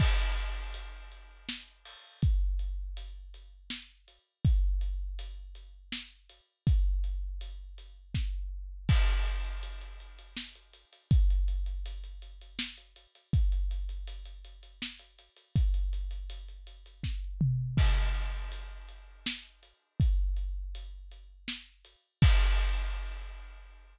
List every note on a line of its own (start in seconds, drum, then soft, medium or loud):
0.00 kick medium
0.00 crash loud
0.37 closed hi-hat medium
0.74 closed hi-hat medium
1.12 closed hi-hat medium
1.49 snare medium
1.85 open hi-hat medium
2.22 kick medium
2.22 closed hi-hat medium
2.59 closed hi-hat medium
2.97 closed hi-hat medium
3.34 closed hi-hat medium
3.70 snare medium
4.08 closed hi-hat medium
4.45 kick medium
4.45 closed hi-hat medium
4.81 closed hi-hat medium
5.19 closed hi-hat medium
5.55 closed hi-hat medium
5.92 snare medium
5.92 closed hi-hat soft
6.29 closed hi-hat medium
6.67 kick medium
6.67 closed hi-hat medium
7.04 closed hi-hat medium
7.41 closed hi-hat medium
7.78 closed hi-hat medium
8.15 kick medium
8.15 snare medium
8.89 kick medium
8.89 crash medium
9.07 closed hi-hat medium
9.25 closed hi-hat medium
9.45 closed hi-hat medium
9.63 closed hi-hat medium
9.81 closed hi-hat medium
10.00 closed hi-hat medium
10.19 closed hi-hat medium
10.37 snare medium
10.55 closed hi-hat medium
10.73 closed hi-hat medium
10.93 closed hi-hat medium
11.11 kick loud
11.11 closed hi-hat medium
11.30 closed hi-hat medium
11.48 closed hi-hat medium
11.66 closed hi-hat medium
11.86 closed hi-hat medium
12.04 closed hi-hat medium
12.22 closed hi-hat medium
12.41 closed hi-hat medium
12.59 snare loud
12.77 closed hi-hat medium
12.96 closed hi-hat medium
13.15 closed hi-hat medium
13.33 kick medium
13.33 closed hi-hat medium
13.52 closed hi-hat medium
13.71 closed hi-hat medium
13.89 closed hi-hat medium
14.07 closed hi-hat medium
14.25 closed hi-hat medium
14.44 closed hi-hat medium
14.63 closed hi-hat medium
14.82 snare medium
14.99 closed hi-hat medium
15.19 closed hi-hat medium
15.36 closed hi-hat medium
15.56 kick medium
15.56 closed hi-hat medium
15.74 closed hi-hat medium
15.93 closed hi-hat medium
16.11 closed hi-hat medium
16.30 closed hi-hat medium
16.48 closed hi-hat medium
16.67 closed hi-hat medium
16.86 closed hi-hat medium
17.03 kick medium
17.03 snare medium
17.41 mid tom medium
17.77 kick medium
17.77 crash medium
18.14 closed hi-hat medium
18.52 closed hi-hat medium
18.88 closed hi-hat medium
19.26 snare loud
19.63 closed hi-hat medium
20.00 kick medium
20.00 closed hi-hat medium
20.36 closed hi-hat medium
20.75 closed hi-hat medium
21.11 closed hi-hat medium
21.48 snare medium
21.85 closed hi-hat medium
22.22 kick loud
22.22 crash loud